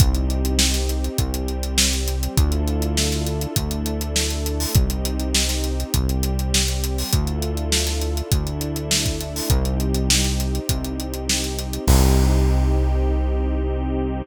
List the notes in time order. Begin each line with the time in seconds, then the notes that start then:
0.00 C2 C4 D#4 G4, kick, closed hi-hat
0.15 closed hi-hat
0.30 closed hi-hat
0.45 closed hi-hat
0.59 snare
0.74 snare, closed hi-hat
0.89 closed hi-hat
1.04 closed hi-hat
1.18 C2 G3 C4 G4, kick, closed hi-hat
1.34 closed hi-hat
1.48 closed hi-hat
1.63 closed hi-hat
1.78 snare
1.93 snare, closed hi-hat
2.08 closed hi-hat
2.23 closed hi-hat
2.37 D2 D4 E4 F4 A4, kick, closed hi-hat
2.52 closed hi-hat
2.68 closed hi-hat
2.82 closed hi-hat
2.97 snare
3.12 snare, closed hi-hat
3.26 closed hi-hat
3.41 closed hi-hat
3.56 D2 A3 D4 E4 A4, kick, closed hi-hat
3.71 closed hi-hat
3.86 closed hi-hat
4.01 closed hi-hat
4.16 snare
4.30 closed hi-hat
4.46 closed hi-hat
4.60 open hi-hat
4.75 C2 C4 D#4 G4, kick, closed hi-hat
4.90 closed hi-hat
5.05 closed hi-hat
5.20 closed hi-hat
5.35 snare
5.49 snare, closed hi-hat
5.64 closed hi-hat
5.80 closed hi-hat
5.94 C2 G3 C4 G4, kick, closed hi-hat
6.09 closed hi-hat
6.23 closed hi-hat
6.39 closed hi-hat
6.54 snare
6.68 closed hi-hat
6.84 closed hi-hat
6.98 open hi-hat
7.12 D2 D4 E4 F4 A4, kick, closed hi-hat
7.27 closed hi-hat
7.42 closed hi-hat
7.57 closed hi-hat
7.72 snare
7.87 snare, closed hi-hat
8.01 closed hi-hat
8.17 closed hi-hat
8.32 D2 A3 D4 E4 A4, kick, closed hi-hat
8.47 closed hi-hat
8.61 closed hi-hat
8.76 closed hi-hat
8.91 snare
9.06 kick, closed hi-hat
9.21 closed hi-hat
9.36 open hi-hat
9.50 C2 C4 D#4 G4, kick, closed hi-hat
9.65 closed hi-hat
9.80 closed hi-hat
9.94 closed hi-hat
10.10 snare
10.24 snare, closed hi-hat
10.40 closed hi-hat
10.55 closed hi-hat
10.69 C2, kick, closed hi-hat
10.85 closed hi-hat
11.00 closed hi-hat
11.14 closed hi-hat
11.29 snare
11.44 closed hi-hat
11.59 closed hi-hat
11.73 closed hi-hat
11.87 C2 C4 D#4 G4, kick, crash